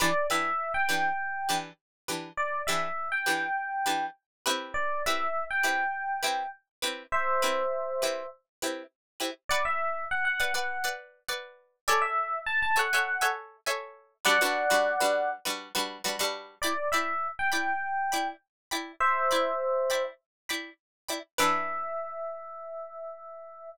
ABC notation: X:1
M:4/4
L:1/16
Q:1/4=101
K:Em
V:1 name="Electric Piano 1"
d2 e3 g7 z4 | d2 e3 g7 z4 | d2 e3 g7 z4 | [ce]8 z8 |
[K:Bm] d e3 f f f4 z6 | d e3 a a f4 z6 | [df]8 z8 | [K:Em] d2 e3 g7 z4 |
[ce]8 z8 | e16 |]
V:2 name="Pizzicato Strings"
[E,DGB]2 [E,DGB]4 [E,DGB]4 [E,DGB]4 [E,DGB]2- | [E,DGB]2 [E,DGB]4 [E,DGB]4 [E,DGB]4 [CEGB]2- | [CEGB]2 [CEGB]4 [CEGB]4 [CEGB]4 [CEGB]2- | [CEGB]2 [CEGB]4 [CEGB]4 [CEGB]4 [CEGB]2 |
[K:Bm] [Bdf]6 [Bdf] [Bdf]2 [Bdf]3 [Bdf]4 | [Ace^g]6 [Aceg] [Aceg]2 [Aceg]3 [Aceg]4 | [G,DFB] [G,DFB]2 [G,DFB]2 [G,DFB]3 [G,DFB]2 [G,DFB]2 [G,DFB] [G,DFB]3 | [K:Em] [Edgb]2 [Edgb]4 [Edgb]4 [Edgb]4 [Edgb]2- |
[Edgb]2 [Edgb]4 [Edgb]4 [Edgb]4 [Edgb]2 | [E,DGB]16 |]